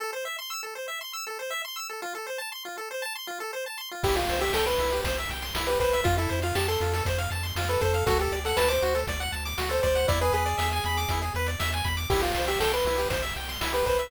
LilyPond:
<<
  \new Staff \with { instrumentName = "Lead 1 (square)" } { \time 4/4 \key a \minor \tempo 4 = 119 r1 | r1 | g'16 f'8 g'16 a'16 b'8. r4 r16 b'16 b'8 | f'16 e'8 f'16 g'16 a'8. r4 r16 b'16 a'8 |
a'16 g'8 a'16 b'16 c''8. r4 r16 c''16 c''8 | d''16 b'16 gis'2 r4. | g'16 f'8 g'16 a'16 b'8. r4 r16 b'16 b'8 | }
  \new Staff \with { instrumentName = "Lead 1 (square)" } { \time 4/4 \key a \minor a'16 c''16 e''16 c'''16 e'''16 a'16 c''16 e''16 c'''16 e'''16 a'16 c''16 e''16 c'''16 e'''16 a'16 | f'16 a'16 c''16 a''16 c'''16 f'16 a'16 c''16 a''16 c'''16 f'16 a'16 c''16 a''16 c'''16 f'16 | e'16 g'16 c''16 e''16 g''16 c'''16 e'16 g'16 c''16 e''16 g''16 c'''16 e'16 g'16 c''16 e''16 | f'16 a'16 c''16 f''16 a''16 c'''16 f'16 a'16 c''16 f''16 a''16 c'''16 f'16 a'16 c''16 f''16 |
fis'16 a'16 d''16 fis''16 a''16 d'''16 fis'16 a'16 d''16 fis''16 a''16 d'''16 fis'16 a'16 d''16 fis''16 | e'16 gis'16 b'16 d''16 e''16 gis''16 b''16 d'''16 e'16 gis'16 b'16 d''16 e''16 gis''16 b''16 d'''16 | e'16 g'16 c''16 e''16 g''16 c'''16 e'16 g'16 c''16 e''16 g''16 c'''16 e'16 g'16 c''16 e''16 | }
  \new Staff \with { instrumentName = "Synth Bass 1" } { \clef bass \time 4/4 \key a \minor r1 | r1 | c,8 c,8 c,8 c,8 c,8 c,8 c,8 c,8 | f,8 f,8 f,8 f,8 f,8 f,8 f,8 f,8 |
d,8 d,8 d,8 d,8 d,8 d,8 d,8 d,8 | e,8 e,8 e,8 e,8 e,8 e,8 e,8 e,8 | c,8 c,8 c,8 c,8 c,8 c,8 c,8 c,8 | }
  \new DrumStaff \with { instrumentName = "Drums" } \drummode { \time 4/4 r4 r4 r4 r4 | r4 r4 r4 r4 | <cymc bd>16 hh16 hh16 hh16 sn16 hh16 hh16 hh16 <hh bd>16 hh16 hh16 hh16 sn16 hh16 <hh bd>16 hh16 | <hh bd>16 hh16 hh16 hh16 sn16 hh16 hh16 hh16 <hh bd>16 hh16 hh16 hh16 sn16 hh16 <hh bd>16 hh16 |
<hh bd>16 hh16 hh16 hh16 sn16 hh16 hh16 hh16 <hh bd>16 hh16 hh16 hh16 sn16 hh16 <hh bd>16 hh16 | <hh bd>16 hh16 hh16 hh16 sn16 hh16 hh16 hh16 <hh bd>16 hh16 hh16 hh16 sn16 hh16 <hh bd>16 hh16 | <cymc bd>16 hh16 hh16 hh16 sn16 hh16 hh16 hh16 <hh bd>16 hh16 hh16 hh16 sn16 hh16 <hh bd>16 hh16 | }
>>